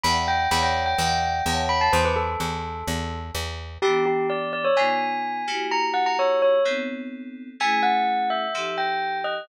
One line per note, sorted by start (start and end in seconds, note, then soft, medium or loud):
0.03 0.48 E2 loud
0.03 0.46 D5 medium
0.03 0.46 E5 medium
0.03 0.46 F#5 medium
0.03 0.46 G5 medium
0.03 0.15 B5 medium
0.28 0.49 G5 medium
0.51 0.95 E2 loud
0.51 0.94 C#5 medium
0.51 0.94 D5 medium
0.51 0.94 E5 medium
0.51 0.94 F#5 medium
0.51 0.63 B5 medium
0.63 0.83 G5 medium
0.86 1.63 G5 medium
0.98 1.42 E2 loud
0.98 1.41 D5 medium
0.98 1.41 E5 medium
0.98 1.41 F#5 medium
0.98 1.41 G5 medium
1.46 1.89 E2 loud
1.46 1.89 C#5 medium
1.46 1.89 E5 medium
1.46 1.89 F#5 medium
1.46 1.89 A5 medium
1.69 1.80 B5 medium
1.81 1.92 A5 medium
1.93 2.36 E2 loud
1.93 2.04 C5 medium
2.05 2.16 B4 medium
2.16 3.19 A4 medium
2.40 2.83 E2 medium
2.88 3.31 E2 loud
3.35 3.78 E2 loud
3.82 4.67 E3 medium
3.82 4.67 B3 medium
3.82 4.67 D4 medium
3.82 4.05 G4 medium
3.82 4.67 G4 medium
4.06 4.26 G4 medium
4.30 4.52 D5 medium
4.53 4.64 D5 medium
4.64 4.76 C#5 medium
4.76 5.44 C#3 medium
4.76 5.44 B3 medium
4.76 5.44 D#4 medium
4.76 5.44 F4 medium
4.76 5.65 G#5 medium
5.47 6.56 A#3 medium
5.47 6.56 E4 medium
5.47 6.56 F#4 medium
5.47 6.56 G4 medium
5.71 5.83 A#5 medium
5.94 6.05 F#5 medium
6.06 6.17 A#5 medium
6.19 6.39 C#5 medium
6.42 6.62 C#5 medium
6.65 7.50 B3 medium
6.65 7.50 C4 medium
6.65 7.50 D#4 medium
6.65 7.50 A4 medium
7.60 8.45 A3 medium
7.60 8.45 C#4 medium
7.60 8.45 E4 medium
7.60 8.45 G#4 medium
7.60 7.82 G#5 medium
7.83 8.28 F#5 medium
8.30 8.76 E5 medium
8.54 9.39 F3 medium
8.54 9.39 D#4 medium
8.54 9.39 G4 medium
8.54 9.39 A4 medium
8.78 9.18 G5 medium
9.24 9.47 D#5 medium